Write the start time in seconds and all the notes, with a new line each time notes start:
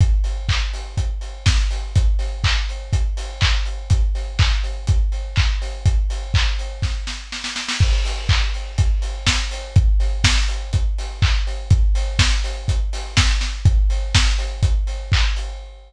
0.01 kick, closed hi-hat
0.24 open hi-hat
0.49 kick, clap
0.73 open hi-hat
0.97 kick, closed hi-hat
1.21 open hi-hat
1.46 kick, snare
1.71 open hi-hat
1.95 kick, closed hi-hat
2.19 open hi-hat
2.44 kick, clap
2.69 open hi-hat
2.93 kick, closed hi-hat
3.17 open hi-hat
3.41 kick, clap
3.65 open hi-hat
3.90 kick, closed hi-hat
4.15 open hi-hat
4.39 kick, clap
4.64 open hi-hat
4.87 kick, closed hi-hat
5.12 open hi-hat
5.36 kick, clap
5.62 open hi-hat
5.86 kick, closed hi-hat
6.10 open hi-hat
6.34 kick, clap
6.59 open hi-hat
6.82 kick, snare
7.07 snare
7.32 snare
7.44 snare
7.56 snare
7.68 snare
7.80 kick, crash
8.05 open hi-hat
8.29 kick, clap
8.54 open hi-hat
8.78 kick, closed hi-hat
9.02 open hi-hat
9.27 kick, snare
9.51 open hi-hat
9.76 kick, closed hi-hat
10.00 open hi-hat
10.24 kick, snare
10.48 open hi-hat
10.73 kick, closed hi-hat
10.98 open hi-hat
11.22 kick, clap
11.47 open hi-hat
11.70 kick, closed hi-hat
11.95 open hi-hat
12.19 kick, snare
12.44 open hi-hat
12.68 kick, closed hi-hat
12.93 open hi-hat
13.17 kick, snare
13.41 snare
13.65 kick, closed hi-hat
13.90 open hi-hat
14.15 kick, snare
14.38 open hi-hat
14.63 kick, closed hi-hat
14.87 open hi-hat
15.12 kick, clap
15.36 open hi-hat